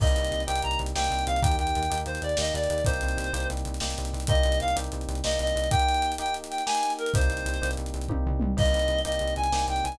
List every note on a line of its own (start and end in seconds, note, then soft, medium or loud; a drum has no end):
0.00 0.13 C2 medium
0.00 0.43 A#3 loud
0.00 0.43 C4 loud
0.00 0.43 D#4 loud
0.00 0.43 G4 medium
0.00 0.42 D#5 medium
0.00 kick loud
0.00 crash medium
0.07 closed hi-hat medium
0.16 0.30 C2 medium
0.16 closed hi-hat medium
0.24 closed hi-hat medium
0.31 0.45 C2 medium
0.31 closed hi-hat medium
0.40 closed hi-hat medium
0.46 0.61 C2 medium
0.46 0.91 A#3 medium
0.46 0.91 C4 medium
0.46 0.91 D#4 medium
0.46 0.91 G4 medium
0.46 0.61 G5 medium
0.46 closed hi-hat loud
0.55 closed hi-hat medium
0.62 0.77 C2 medium
0.62 0.79 A#5 medium
0.62 closed hi-hat medium
0.71 closed hi-hat medium
0.79 0.93 C2 medium
0.79 closed hi-hat medium
0.86 closed hi-hat medium
0.95 1.09 C2 medium
0.95 1.38 A#3 loud
0.95 1.38 C4 loud
0.95 1.38 D#4 medium
0.95 1.38 G4 loud
0.95 1.24 G5 medium
0.95 snare loud
1.04 closed hi-hat medium
1.11 1.24 C2 medium
1.11 closed hi-hat medium
1.19 closed hi-hat medium
1.27 1.40 C2 medium
1.27 1.41 F5 medium
1.27 closed hi-hat medium
1.36 closed hi-hat medium
1.42 1.56 D#2 medium
1.42 1.85 A#3 loud
1.42 1.85 D#4 loud
1.42 1.85 G4 medium
1.42 1.56 G5 medium
1.42 kick loud
1.42 closed hi-hat loud
1.51 closed hi-hat medium
1.58 1.73 D#2 medium
1.58 1.98 G5 medium
1.58 closed hi-hat medium
1.67 closed hi-hat medium
1.75 1.89 D#2 medium
1.75 closed hi-hat medium
1.83 closed hi-hat medium
1.90 2.05 D#2 medium
1.90 2.33 A#3 medium
1.90 2.33 D#4 medium
1.90 2.33 G4 medium
1.90 closed hi-hat loud
1.98 closed hi-hat medium
2.06 2.19 D#2 medium
2.06 2.21 C5 medium
2.06 closed hi-hat medium
2.15 closed hi-hat medium
2.22 2.35 D#2 medium
2.22 2.38 D5 medium
2.22 closed hi-hat medium
2.29 closed hi-hat medium
2.37 2.52 D#2 medium
2.37 2.81 A#3 medium
2.37 2.81 D#4 medium
2.37 2.81 G4 medium
2.37 2.53 D#5 medium
2.37 snare loud
2.45 closed hi-hat medium
2.54 2.67 D#2 medium
2.54 2.84 D5 medium
2.54 closed hi-hat medium
2.64 closed hi-hat medium
2.70 2.83 D#2 medium
2.70 closed hi-hat medium
2.78 closed hi-hat medium
2.85 3.00 C2 medium
2.85 3.29 A#3 loud
2.85 3.29 C4 loud
2.85 3.29 D#4 loud
2.85 3.29 G4 loud
2.85 3.47 C5 medium
2.85 kick loud
2.85 closed hi-hat loud
2.94 closed hi-hat medium
3.01 3.16 C2 medium
3.01 closed hi-hat medium
3.08 closed hi-hat medium
3.17 3.31 C2 medium
3.17 closed hi-hat medium
3.24 closed hi-hat medium
3.33 3.46 C2 medium
3.33 3.76 A#3 medium
3.33 3.76 C4 medium
3.33 3.76 D#4 medium
3.33 3.76 G4 medium
3.33 closed hi-hat loud
3.40 closed hi-hat medium
3.50 3.64 C2 medium
3.50 closed hi-hat medium
3.57 closed hi-hat medium
3.65 3.79 C2 medium
3.65 closed hi-hat medium
3.74 closed hi-hat medium
3.80 3.94 C2 medium
3.80 4.24 A#3 medium
3.80 4.24 C4 medium
3.80 4.24 D#4 medium
3.80 4.24 G4 medium
3.80 snare loud
3.90 closed hi-hat medium
3.98 4.12 C2 medium
3.98 closed hi-hat medium
4.05 closed hi-hat medium
4.13 4.27 C2 medium
4.13 closed hi-hat medium
4.20 closed hi-hat medium
4.27 4.42 C2 medium
4.27 4.71 A#3 loud
4.27 4.71 C4 loud
4.27 4.71 D#4 medium
4.27 4.71 G4 loud
4.27 4.59 D#5 medium
4.27 kick loud
4.27 closed hi-hat loud
4.35 closed hi-hat medium
4.43 4.59 C2 medium
4.43 closed hi-hat medium
4.52 closed hi-hat medium
4.60 4.75 C2 medium
4.60 4.76 F5 medium
4.60 closed hi-hat medium
4.68 closed hi-hat medium
4.75 4.89 C2 medium
4.75 5.19 A#3 medium
4.75 5.19 C4 medium
4.75 5.19 D#4 medium
4.75 5.19 G4 medium
4.75 closed hi-hat loud
4.84 closed hi-hat medium
4.92 5.06 C2 medium
4.92 closed hi-hat medium
5.01 closed hi-hat medium
5.08 5.21 C2 medium
5.08 closed hi-hat medium
5.15 closed hi-hat medium
5.24 5.37 C2 medium
5.24 5.67 A#3 medium
5.24 5.67 C4 medium
5.24 5.67 D#4 medium
5.24 5.67 G4 medium
5.24 5.39 D#5 medium
5.24 snare loud
5.31 closed hi-hat medium
5.39 5.53 C2 medium
5.39 5.69 D#5 medium
5.39 closed hi-hat medium
5.47 closed hi-hat medium
5.56 5.69 C2 medium
5.56 closed hi-hat medium
5.64 closed hi-hat medium
5.71 6.14 A#3 loud
5.71 6.14 D#4 loud
5.71 6.14 G4 loud
5.71 6.11 G5 medium
5.71 kick loud
5.71 closed hi-hat loud
5.79 closed hi-hat medium
5.88 closed hi-hat medium
5.94 closed hi-hat medium
6.02 closed hi-hat medium
6.12 closed hi-hat medium
6.18 6.62 A#3 medium
6.18 6.62 D#4 loud
6.18 6.62 G4 medium
6.18 6.34 G5 medium
6.18 closed hi-hat medium
6.26 closed hi-hat medium
6.34 closed hi-hat medium
6.44 closed hi-hat medium
6.50 6.63 G5 medium
6.50 closed hi-hat medium
6.58 closed hi-hat medium
6.66 7.09 A#3 medium
6.66 7.09 D#4 medium
6.66 7.09 G4 medium
6.66 6.93 G#5 medium
6.66 snare loud
6.75 closed hi-hat medium
6.83 closed hi-hat medium
6.90 closed hi-hat medium
6.99 7.12 A#4 medium
6.99 closed hi-hat medium
7.06 closed hi-hat medium
7.14 7.28 C2 medium
7.14 7.57 A#3 loud
7.14 7.57 C4 loud
7.14 7.57 D#4 loud
7.14 7.57 G4 loud
7.14 7.71 C5 medium
7.14 kick loud
7.14 closed hi-hat loud
7.21 closed hi-hat medium
7.29 7.43 C2 medium
7.29 closed hi-hat medium
7.37 closed hi-hat medium
7.46 7.59 C2 medium
7.46 closed hi-hat medium
7.54 closed hi-hat medium
7.62 7.75 C2 medium
7.62 8.05 A#3 medium
7.62 8.05 C4 medium
7.62 8.05 D#4 medium
7.62 8.05 G4 medium
7.62 closed hi-hat medium
7.71 closed hi-hat medium
7.77 7.92 C2 medium
7.77 closed hi-hat medium
7.86 closed hi-hat medium
7.94 8.07 C2 medium
7.94 closed hi-hat medium
8.01 closed hi-hat medium
8.08 8.24 C2 medium
8.08 8.52 A#3 medium
8.08 8.52 C4 medium
8.08 8.52 D#4 medium
8.08 8.52 G4 medium
8.08 kick medium
8.08 high tom medium
8.26 8.40 C2 medium
8.26 floor tom medium
8.40 8.55 C2 medium
8.40 mid tom loud
8.57 8.70 C2 medium
8.57 9.00 A#3 loud
8.57 9.00 C4 medium
8.57 9.00 D#4 medium
8.57 9.00 G4 medium
8.57 9.00 D#5 medium
8.57 kick loud
8.57 crash medium
8.66 closed hi-hat medium
8.74 8.87 C2 medium
8.74 closed hi-hat medium
8.79 closed hi-hat medium
8.88 9.02 C2 medium
8.88 closed hi-hat medium
8.98 closed hi-hat medium
9.05 9.19 C2 medium
9.05 9.48 A#3 medium
9.05 9.48 C4 medium
9.05 9.48 D#4 medium
9.05 9.48 G4 medium
9.05 9.34 D#5 medium
9.05 closed hi-hat medium
9.12 closed hi-hat medium
9.19 9.35 C2 medium
9.19 closed hi-hat medium
9.28 closed hi-hat medium
9.36 9.50 C2 medium
9.36 9.66 G#5 medium
9.36 closed hi-hat medium
9.44 closed hi-hat medium
9.52 9.65 C2 medium
9.52 9.95 A#3 medium
9.52 9.95 C4 medium
9.52 9.95 D#4 medium
9.52 9.95 G4 medium
9.52 snare loud
9.59 closed hi-hat medium
9.68 9.81 C2 medium
9.68 9.84 G5 medium
9.68 closed hi-hat medium
9.76 closed hi-hat medium
9.84 9.98 C2 medium
9.84 9.97 G#5 medium
9.84 closed hi-hat medium
9.92 closed hi-hat medium